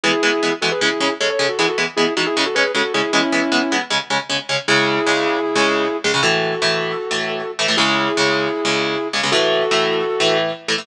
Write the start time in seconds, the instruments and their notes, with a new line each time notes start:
0.04 overdriven guitar E3 G#3 B3, distortion guitar E4 G#4
0.23 overdriven guitar E3 G#3 B3
0.43 overdriven guitar E3 G#3 B3
0.62 overdriven guitar E3 G#3 B3, distortion guitar F#4 A4
0.72 distortion guitar G#4 B4
0.81 overdriven guitar C#3 G#3 C#4, distortion guitar E4 G#4
1.00 overdriven guitar C#3 G#3 C#4
1.20 overdriven guitar C#3 G#3 C#4, distortion guitar A4 C#5
1.30 distortion guitar A4 C#5
1.39 overdriven guitar C#3 G#3 C#4
1.49 distortion guitar F#4 A4
1.59 overdriven guitar E3 G#3 B3, distortion guitar E4 G#4
1.68 distortion guitar F#4 A4
1.78 overdriven guitar E3 G#3 B3
1.96 overdriven guitar E3 G#3 B3, distortion guitar E4 G#4
2.17 overdriven guitar E3 G#3 B3, distortion guitar D#4 F#4
2.26 distortion guitar E4 G#4
2.37 overdriven guitar C#3 G#3 C#4
2.46 distortion guitar F#4 A4
2.55 overdriven guitar C#3 G#3 C#4, distortion guitar G#4 B4
2.75 overdriven guitar C#3 G#3 C#4, distortion guitar F#4 A4
2.94 overdriven guitar C#3 G#3 C#4, distortion guitar E4 G#4
3.13 overdriven guitar E3 G#3 B3, distortion guitar C#4 E4
3.32 overdriven guitar E3 G#3 B3
3.52 overdriven guitar E3 G#3 B3
3.72 overdriven guitar E3 G#3 B3
3.90 overdriven guitar C#3 G#3 C#4
4.10 overdriven guitar C#3 G#3 C#4
4.30 overdriven guitar C#3 G#3 C#4
4.49 overdriven guitar C#3 G#3 C#4
4.68 overdriven guitar C#2 C#3 G#3, distortion guitar E4 G#4
5.07 overdriven guitar C#2 C#3 G#3
5.55 overdriven guitar C#2 C#3 G#3
6.04 overdriven guitar C#2 C#3 G#3
6.14 overdriven guitar C#2 C#3 G#3
6.23 overdriven guitar A2 E3 A3, distortion guitar F#4 A4
6.62 overdriven guitar A2 E3 A3
7.11 overdriven guitar A2 E3 A3
7.59 overdriven guitar A2 E3 A3
7.68 overdriven guitar A2 E3 A3
7.77 overdriven guitar C#2 C#3 G#3, distortion guitar E4 G#4
8.17 overdriven guitar C#2 C#3 G#3
8.65 overdriven guitar C#2 C#3 G#3
9.13 overdriven guitar C#2 C#3 G#3
9.23 overdriven guitar C#2 C#3 G#3
9.32 overdriven guitar A2 E3 A3, distortion guitar F#4 A4
9.71 overdriven guitar A2 E3 A3
10.20 overdriven guitar A2 E3 A3
10.68 overdriven guitar A2 E3 A3
10.78 overdriven guitar A2 E3 A3